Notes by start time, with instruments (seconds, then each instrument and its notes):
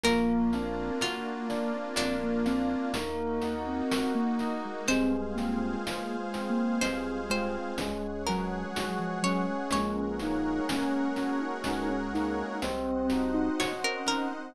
0.04 drawbar organ A#1, electric piano 2 A#3, ocarina A#3, pad 5 (bowed) A#3 D4 F4, tubular bells A#4, pizzicato strings A#4, closed hi-hat
0.53 ocarina C4, electric piano 2 D4, tubular bells F5, closed hi-hat
1.01 ocarina A#3, pizzicato strings F4, electric piano 2 F#4, tubular bells A#4, closed hi-hat
1.49 ocarina A#3, electric piano 2 D4, tubular bells D5, closed hi-hat
1.74 ocarina C4
1.96 drawbar organ A#1, electric piano 2 A#3, pizzicato strings D4, tubular bells A#4, closed hi-hat
2.23 ocarina A#3
2.46 ocarina C4, electric piano 2 D4, tubular bells F5, closed hi-hat
2.94 drawbar organ D#2, electric piano 2 A#3, ocarina A#3, pad 5 (bowed) A#3 D#4 F#4, tubular bells A#4, closed hi-hat
3.42 electric piano 2 D#4, tubular bells F#5, closed hi-hat
3.67 ocarina C4
3.91 electric piano 2 F#4, tubular bells A#4, closed hi-hat
4.15 ocarina A#3
4.39 electric piano 2 D#4, tubular bells D#5, closed hi-hat
4.65 ocarina G#3
4.88 drawbar organ C2, electric piano 2 G#3, tubular bells G#3, ocarina C4, pad 5 (bowed) G#4 C5 F5, pizzicato strings C5, closed hi-hat
5.11 ocarina C4
5.35 ocarina A#3, electric piano 2 C4, tubular bells F4, closed hi-hat
5.59 ocarina A#3
5.85 tubular bells G#3, ocarina A#3, electric piano 2 F4, closed hi-hat
6.17 ocarina G#3
6.33 electric piano 2 C4, tubular bells C4, closed hi-hat
6.50 ocarina A#3
6.81 drawbar organ C2, electric piano 2 G#3, tubular bells G#3, ocarina C4, pizzicato strings C5, closed hi-hat
7.29 ocarina G#3, electric piano 2 C4, tubular bells F4, pizzicato strings C5, closed hi-hat
7.78 drawbar organ C#2, electric piano 2 G#3, tubular bells G#3, pad 5 (bowed) G#4 C#5 F#5, closed hi-hat
8.27 ocarina F#3, electric piano 2 C#4, tubular bells F#4, pizzicato strings A#4, closed hi-hat
8.75 tubular bells G#3, electric piano 2 F#4, closed hi-hat
8.99 ocarina F3
9.23 ocarina F#3, electric piano 2 C#4, tubular bells C#4, pizzicato strings C#5, closed hi-hat
9.50 ocarina G#3
9.71 drawbar organ A#1, tubular bells G#3, electric piano 2 G#3, ocarina C#4, pad 5 (bowed) G#4 A#4 C#5 F#5, pizzicato strings C#5, closed hi-hat
10.20 electric piano 2 A#3, tubular bells A#3, ocarina D#4, closed hi-hat
10.69 tubular bells C#4, electric piano 2 C#4, ocarina C#4, closed hi-hat
11.16 ocarina C#4, electric piano 2 F#4, tubular bells F#4, closed hi-hat
11.41 ocarina D#4
11.64 drawbar organ C#2, tubular bells G#3, electric piano 2 C#4, closed hi-hat
11.90 ocarina C#4
12.14 electric piano 2 A#3, tubular bells A#3, ocarina D#4, closed hi-hat
12.62 drawbar organ C2, tubular bells C4, electric piano 2 C4, ocarina C4, pad 5 (bowed) C5 D#5 F#5, closed hi-hat
13.10 electric piano 2 D#4, tubular bells F#4, closed hi-hat
13.34 ocarina D#4
13.59 tubular bells C4, electric piano 2 F#4, pizzicato strings C#5, closed hi-hat
13.84 ocarina C#4, pizzicato strings A#4
14.06 tubular bells D#4, electric piano 2 D#4, pizzicato strings A#4, closed hi-hat
14.31 ocarina C4